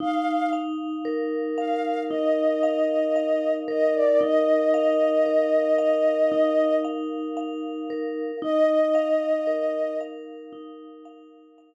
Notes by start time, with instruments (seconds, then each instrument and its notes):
0.00 vibraphone D#4, ocarina F5
0.53 vibraphone F5
1.05 vibraphone A#4
1.58 vibraphone F5, ocarina F5
2.10 vibraphone D#4, ocarina D#5
2.63 vibraphone F5
3.16 vibraphone F5
3.68 vibraphone A#4, ocarina D#5
3.95 ocarina D5
4.21 vibraphone D#4, ocarina D#5
4.74 vibraphone F5
5.26 vibraphone A#4
5.79 vibraphone F5
6.32 vibraphone D#4
6.84 vibraphone F5
7.37 vibraphone F5
7.90 vibraphone A#4
8.42 vibraphone D#4, ocarina D#5
8.95 vibraphone F5
9.47 vibraphone A#4
10.01 vibraphone F5
10.53 vibraphone D#4
11.05 vibraphone F5
11.58 vibraphone F5